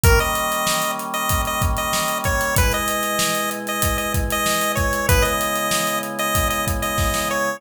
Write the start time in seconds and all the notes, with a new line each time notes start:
0.03 D#3 G3 A#3 C#4 A#4, kick, closed hi-hat
0.19 D#5, closed hi-hat
0.35 closed hi-hat
0.52 closed hi-hat
0.67 snare
0.82 closed hi-hat
0.99 closed hi-hat
1.14 D#5, closed hi-hat
1.29 kick, closed hi-hat
1.45 D#5, closed hi-hat
1.62 kick, closed hi-hat
1.77 D#5, closed hi-hat
1.93 snare
2.08 closed hi-hat
2.24 C#5, kick, closed hi-hat
2.41 closed hi-hat
2.56 B2 G#3 E4 B4, kick, closed hi-hat
2.72 D#5, closed hi-hat
2.88 closed hi-hat
3.03 closed hi-hat
3.19 snare
3.35 closed hi-hat
3.51 closed hi-hat
3.67 D#5, closed hi-hat
3.82 kick, closed hi-hat
3.98 D#5, closed hi-hat
4.14 kick, closed hi-hat
4.30 D#5, closed hi-hat
4.46 snare
4.61 closed hi-hat
4.75 C#5, kick, closed hi-hat
4.93 closed hi-hat
5.09 C#3 G#3 B3 E4 B4, kick, closed hi-hat
5.22 D#5, closed hi-hat
5.41 closed hi-hat
5.55 closed hi-hat
5.71 snare
5.87 closed hi-hat
6.03 closed hi-hat
6.19 D#5, closed hi-hat
6.35 kick, closed hi-hat
6.50 D#5, closed hi-hat
6.67 kick, closed hi-hat
6.82 D#5, closed hi-hat
6.98 kick, snare
7.14 snare
7.31 C#5